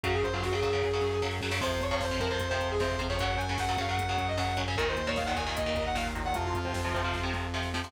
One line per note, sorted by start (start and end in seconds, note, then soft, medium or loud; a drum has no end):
0.03 0.20 F#2 medium
0.03 0.27 C#3 medium
0.03 0.27 F#3 medium
0.03 0.14 F#4 loud
0.03 kick medium
0.03 closed hi-hat medium
0.14 0.24 G#4 medium
0.14 kick medium
0.23 0.40 F#2 medium
0.23 0.33 C5 medium
0.23 kick medium
0.23 closed hi-hat medium
0.32 0.49 C#3 medium
0.32 0.49 F#3 medium
0.32 0.43 F4 medium
0.32 kick medium
0.43 0.60 F#2 medium
0.43 0.52 F#4 medium
0.43 kick medium
0.43 snare medium
0.52 0.60 C#3 medium
0.52 0.60 F#3 medium
0.52 1.19 G#4 medium
0.52 kick medium
0.62 0.80 F#2 medium
0.62 0.70 C#3 medium
0.62 0.70 F#3 medium
0.62 kick medium
0.62 closed hi-hat medium
0.72 0.89 C#3 medium
0.72 0.89 F#3 medium
0.72 kick medium
0.82 1.00 F#2 medium
0.82 kick medium
0.82 snare medium
0.93 1.17 C#3 medium
0.93 1.17 F#3 medium
1.01 1.18 F#2 medium
1.01 snare medium
1.22 1.40 F#2 loud
1.22 1.38 C#3 medium
1.22 1.38 F#3 medium
1.22 snare medium
1.31 snare medium
1.41 1.57 F#2 medium
1.41 1.50 C#3 medium
1.41 1.50 F#3 medium
1.41 snare medium
1.51 1.59 C#3 medium
1.51 1.59 F#3 medium
1.51 snare loud
1.61 1.78 F2 loud
1.61 1.85 C3 medium
1.61 1.85 F3 medium
1.61 1.82 C5 loud
1.61 kick medium
1.61 crash medium
1.71 kick medium
1.81 1.98 F2 medium
1.81 1.92 C#5 medium
1.81 kick medium
1.81 closed hi-hat medium
1.91 2.07 C3 medium
1.91 2.07 F3 medium
1.91 2.01 C#5 medium
1.91 kick medium
2.00 2.17 F2 medium
2.00 2.19 C5 loud
2.00 kick medium
2.00 snare loud
2.11 2.19 C3 medium
2.11 2.19 F3 medium
2.11 kick medium
2.20 2.37 F2 medium
2.20 2.28 C3 medium
2.20 2.28 F3 medium
2.20 2.29 A#4 medium
2.20 kick medium
2.20 closed hi-hat medium
2.30 2.47 C3 medium
2.30 2.47 F3 medium
2.30 2.47 C5 medium
2.30 kick medium
2.39 2.58 F2 medium
2.39 kick medium
2.39 closed hi-hat loud
2.49 2.75 C3 medium
2.49 2.75 F3 medium
2.49 2.67 C5 medium
2.49 kick medium
2.60 2.77 F2 loud
2.60 kick medium
2.60 closed hi-hat medium
2.69 2.81 G#4 medium
2.69 kick medium
2.79 2.97 F2 medium
2.79 2.96 C3 medium
2.79 2.96 F3 medium
2.79 2.97 C5 medium
2.79 kick medium
2.79 snare medium
2.91 kick medium
2.99 3.18 F2 medium
2.99 3.07 C3 medium
2.99 3.07 F3 medium
2.99 kick medium
2.99 closed hi-hat medium
3.09 3.18 C3 medium
3.09 3.18 F3 medium
3.09 3.19 C#5 medium
3.09 kick medium
3.19 3.37 F#2 loud
3.19 3.44 C#3 medium
3.19 3.44 F#3 medium
3.19 3.38 F#5 loud
3.19 kick medium
3.19 closed hi-hat medium
3.31 kick medium
3.37 3.54 F#2 medium
3.37 3.47 G#5 loud
3.37 kick medium
3.37 closed hi-hat medium
3.49 3.65 C#3 medium
3.49 3.65 F#3 medium
3.49 3.59 G#5 medium
3.49 kick medium
3.58 3.75 F#2 medium
3.58 3.78 F#5 medium
3.58 kick medium
3.58 snare loud
3.68 3.76 C#3 medium
3.68 3.76 F#3 medium
3.68 kick medium
3.77 3.94 F#2 medium
3.77 3.86 C#3 medium
3.77 3.86 F#3 medium
3.77 3.90 F5 loud
3.77 kick medium
3.77 closed hi-hat medium
3.87 4.04 C#3 medium
3.87 4.04 F#3 medium
3.87 4.07 F#5 medium
3.87 kick medium
3.97 4.17 F#2 medium
3.97 kick medium
3.97 closed hi-hat loud
4.08 4.33 C#3 medium
4.08 4.33 F#3 medium
4.08 4.26 F#5 medium
4.08 kick medium
4.17 4.34 F#2 medium
4.17 kick medium
4.17 closed hi-hat medium
4.28 4.38 D#5 loud
4.28 kick medium
4.38 4.54 F#2 medium
4.38 4.53 C#3 medium
4.38 4.53 F#3 medium
4.38 4.57 F#5 medium
4.38 kick medium
4.38 snare medium
4.49 kick medium
4.57 4.75 F#2 medium
4.57 4.65 C#3 medium
4.57 4.65 F#3 medium
4.57 kick medium
4.57 closed hi-hat medium
4.68 4.76 C#3 medium
4.68 4.76 F#3 medium
4.68 4.77 G#5 medium
4.68 kick medium
4.76 4.95 D#2 loud
4.76 5.01 A#2 medium
4.76 5.01 D#3 loud
4.76 4.87 A#4 loud
4.76 kick loud
4.76 closed hi-hat medium
4.87 5.06 C5 loud
4.87 kick medium
4.96 5.13 D#2 medium
4.96 kick medium
4.96 closed hi-hat medium
5.07 5.23 A#2 medium
5.07 5.23 D#3 medium
5.07 5.16 C#5 loud
5.07 kick medium
5.16 5.35 D#2 medium
5.16 5.26 F5 medium
5.16 kick medium
5.16 snare medium
5.25 5.35 A#2 medium
5.25 5.35 D#3 medium
5.25 5.35 F#5 medium
5.25 kick medium
5.36 5.52 D#2 medium
5.36 5.44 A#2 medium
5.36 5.44 D#3 medium
5.36 5.54 G#5 medium
5.36 kick medium
5.36 closed hi-hat medium
5.46 5.62 A#2 medium
5.46 5.62 D#3 medium
5.46 kick medium
5.56 5.75 D#2 medium
5.56 5.83 D#5 medium
5.56 kick medium
5.56 closed hi-hat loud
5.66 5.90 A#2 medium
5.66 5.90 D#3 medium
5.66 kick medium
5.75 5.94 D#2 medium
5.75 kick medium
5.75 closed hi-hat medium
5.86 5.96 F#5 medium
5.86 kick medium
5.95 6.12 D#2 medium
5.95 6.11 A#2 medium
5.95 6.11 D#3 medium
5.95 6.05 F5 medium
5.95 kick medium
5.95 snare loud
6.07 kick medium
6.15 6.33 D#2 medium
6.15 6.23 A#2 medium
6.15 6.23 D#3 medium
6.15 kick medium
6.15 closed hi-hat medium
6.25 6.33 A#2 medium
6.25 6.33 D#3 medium
6.25 6.35 F#5 medium
6.25 kick medium
6.34 6.52 F2 medium
6.34 6.58 C3 medium
6.34 6.58 F3 medium
6.34 6.45 F4 loud
6.34 kick medium
6.34 closed hi-hat medium
6.44 6.55 F4 loud
6.44 kick medium
6.53 6.72 F2 medium
6.53 7.21 F4 medium
6.53 kick medium
6.53 closed hi-hat medium
6.65 6.81 C3 medium
6.65 6.81 F3 medium
6.65 kick medium
6.74 6.91 F2 medium
6.74 kick medium
6.74 snare loud
6.84 6.92 C3 medium
6.84 6.92 F3 medium
6.84 kick medium
6.94 7.11 F2 medium
6.94 7.02 C3 medium
6.94 7.02 F3 medium
6.94 kick medium
6.94 closed hi-hat medium
7.04 7.20 C3 medium
7.04 7.20 F3 medium
7.04 kick medium
7.13 7.32 F2 medium
7.13 kick medium
7.13 snare medium
7.23 7.47 C3 medium
7.23 7.47 F3 medium
7.33 7.50 F2 medium
7.33 snare medium
7.54 7.71 F2 medium
7.54 7.70 C3 medium
7.54 7.70 F3 medium
7.54 snare medium
7.63 snare medium
7.74 7.91 F2 medium
7.74 7.82 C3 medium
7.74 7.82 F3 medium
7.74 snare medium
7.84 7.92 C3 medium
7.84 7.92 F3 medium
7.84 snare medium